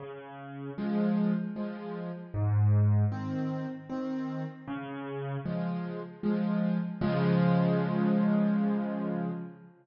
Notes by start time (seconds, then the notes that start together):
0.00 C#3
0.78 F3 G#3
1.56 F3 G#3
2.34 G#2
3.12 D#3 C4
3.89 D#3 C4
4.68 C#3
5.45 F3 G#3
6.23 F3 G#3
7.01 C#3 F3 G#3